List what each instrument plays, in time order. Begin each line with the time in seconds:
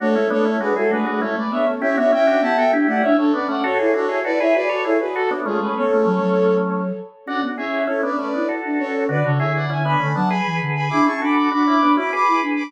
0.00 flute A3 A4 C#5, drawbar organ D4 F#4
0.15 flute G#3, drawbar organ C#4 E4
0.30 flute A3 A4 C#5, drawbar organ B3 D4
0.45 drawbar organ C#4 E4
0.59 flute G#3 G#4 B4, drawbar organ D4 F#4
0.76 flute G#3 F#4 A4, drawbar organ E4 G#4
0.90 flute A3 G#4 B4, drawbar organ D4 F#4
1.06 flute A3, drawbar organ D4 F#4
1.21 flute G#3 A4 C#5, drawbar organ C#4 E4
1.34 flute A3 B4 D5
1.51 flute B3 C#5 E5, drawbar organ B3 D4
1.67 drawbar organ A3 C#4
1.80 flute C#4 C#5 E5, drawbar organ E4 G4
1.97 flute B3 C#5 E5, drawbar organ D4 F#4
2.12 flute C#4 E5 G5, drawbar organ C#4 E4
2.27 drawbar organ D4 F#4
2.41 flute B3 F#5 A5, drawbar organ E4 G4
2.57 flute B3 E5 G5, drawbar organ F#4 A4
2.72 flute D4, drawbar organ E4 G4
2.87 flute A3 D5 F#5, drawbar organ E4 G4
3.03 drawbar organ C#4 E4, flute D4 C#5 E5
3.17 flute D4 A4 C#5
3.33 drawbar organ B3 D4, flute C#4 B4 D5
3.48 drawbar organ A3 C#4, flute D5 F#5
3.64 drawbar organ F#4 A4, flute F#4 A4 C#5
3.79 drawbar organ E4 G#4, flute E4
3.94 drawbar organ D4 F#4, flute F#4 A4 C#5
4.09 drawbar organ E4 G#4
4.24 flute E4 B4 D5, drawbar organ F#4 A4
4.40 flute E4 C#5 E5, drawbar organ G#4 B4
4.54 flute F#4 B4 D5, drawbar organ G#4 B4
4.69 flute F#4, drawbar organ A4 C#5
4.83 drawbar organ E4 G#4, flute E4 A4 C#5
4.99 flute F#4 G#4 B4
5.14 flute F#4 A4, drawbar organ F#4 A4
5.31 drawbar organ B3 D4
5.46 flute G#3 F4 G#4, drawbar organ A3 C#4
5.60 flute G#3 G#4 B4
5.76 flute B3 A4 C#5
5.90 flute A3
6.05 flute F#3
6.22 flute F#3
7.26 flute C#4 D5 F#5, drawbar organ D4 F#4
7.42 flute B3, drawbar organ D4 F#4
7.57 flute C#4 C#5 E5, drawbar organ E4 G#4
7.87 drawbar organ C#4 E4, flute C#4 A4 C#5
8.03 drawbar organ B3 D4, flute B4 D5
8.17 drawbar organ A3 C#4, flute C#4 B4 D5
8.33 drawbar organ B3 D4, flute E4
8.49 drawbar organ F#4 A4
8.65 flute D4
8.79 flute C#4 A4 C#5
9.09 flute D3 B4 D5, drawbar organ D4 F#4
9.24 flute C#3 A4 C#5, drawbar organ D4 F#4
9.38 flute D3 C#5 E5, drawbar organ E4 G#4
9.56 flute D5 F#5
9.68 flute D3 E5 G#5, drawbar organ C#4 E4
9.84 drawbar organ B3 D4, flute G#5 B5
10.00 flute D3, drawbar organ A3 C#4
10.14 flute F#3 F#5 A5, drawbar organ B3 D4
10.29 drawbar organ G#4 B4, flute G#5 B5
10.46 flute E3
10.61 flute D3
10.76 flute G#5 B5
10.89 flute D4 B5 D6, drawbar organ E4 G#4
11.05 flute C#4 A5 C#6, drawbar organ E4 G#4
11.21 flute D4 B5 D6, drawbar organ F#4 A4
11.36 flute B5 D6
11.51 flute D4 B5 D6, drawbar organ D4 F#4
11.67 drawbar organ C#4 E4, flute B5 D6
11.82 drawbar organ B3 D4, flute D4
11.95 drawbar organ C#4 E4, flute F#4 B5 D6
12.13 drawbar organ G#4 B4, flute B5 D6
12.27 flute E4
12.42 flute D4
12.56 flute B5 D6